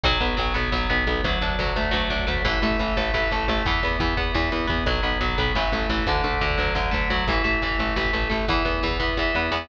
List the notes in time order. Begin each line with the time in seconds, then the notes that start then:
0.04 B1 F#3, kick, crash
0.12 kick
0.20 B1 B3, kick, closed hi-hat
0.29 kick
0.37 B1 F#3, kick, closed hi-hat
0.47 kick
0.54 B1 B3, kick, closed hi-hat
0.64 kick
0.72 B1 F#3, kick, snare
0.81 kick
0.90 B1 B3, kick, closed hi-hat
0.98 kick
1.07 B1 B3, kick, closed hi-hat
1.16 kick
1.24 D2 F#3, kick, closed hi-hat
1.33 kick
1.41 D2 D4, kick, closed hi-hat
1.50 kick
1.59 D2 F#3, kick, closed hi-hat
1.67 kick
1.76 D2 A3, kick, closed hi-hat
1.85 kick
1.91 D2 F#3, kick, snare
2.02 kick
2.10 D2 D4, kick, closed hi-hat
2.19 kick
2.27 D2 A3, kick, closed hi-hat
2.36 kick
2.45 A1 E3, kick, closed hi-hat
2.54 kick
2.62 A1 A3, kick, closed hi-hat
2.71 kick
2.79 A1 E3, kick, closed hi-hat
2.88 kick
2.97 A1 A3, kick, closed hi-hat
3.05 kick
3.14 A1 E3, kick, snare
3.22 kick
3.31 A1 A3, kick, closed hi-hat
3.40 kick
3.48 A1 A3, kick, closed hi-hat
3.57 kick
3.66 E2 E3, kick, closed hi-hat
3.74 kick
3.83 E2 B3, kick, closed hi-hat
3.91 kick
4.00 E2 E3, kick, closed hi-hat
4.09 kick
4.17 E2 B3, kick, closed hi-hat
4.26 kick
4.34 E2 E3, kick, snare
4.43 kick
4.52 E2 B3, kick, closed hi-hat
4.60 kick
4.67 E2 B3, kick, closed hi-hat
4.78 kick
4.86 B1 F#3, kick, closed hi-hat
4.95 kick
5.03 B1 B3, kick, closed hi-hat
5.12 kick
5.21 B1 F#3, kick, closed hi-hat
5.29 kick
5.38 B1 B3, kick, closed hi-hat
5.47 kick
5.55 A1 E3, kick, snare
5.64 kick
5.72 A1 A3, kick, closed hi-hat
5.81 kick
5.89 A1 E3, kick, closed hi-hat
5.98 kick
6.07 D2 D3, kick, closed hi-hat
6.16 kick
6.24 D2 A3, kick, closed hi-hat
6.33 kick
6.41 D2 D3, kick, closed hi-hat
6.50 kick
6.58 D2 F#3, kick, closed hi-hat
6.67 kick
6.75 D2 D3, kick, snare
6.85 kick
6.91 D2 A3, kick, closed hi-hat
7.02 kick
7.10 D2 F#3, kick
7.19 kick
7.28 A1 E3, kick, closed hi-hat
7.36 kick
7.44 A1 A3, kick, closed hi-hat
7.54 kick
7.62 A1 E3, kick, closed hi-hat
7.71 kick
7.79 A1 A3, kick, closed hi-hat
7.88 kick
7.96 A1 E3, kick, snare
8.05 kick
8.13 A1 A3, kick, closed hi-hat
8.22 kick
8.30 A1 A3, kick, closed hi-hat
8.40 kick
8.48 E2 E3, kick, closed hi-hat
8.57 kick
8.65 E2 B3, kick, closed hi-hat
8.74 kick
8.83 E2 E3, kick, closed hi-hat
8.91 kick
9.00 E2 B3, kick, closed hi-hat
9.09 kick
9.17 E2 E3, kick, snare
9.35 E2 B3, snare
9.52 E2 B3, snare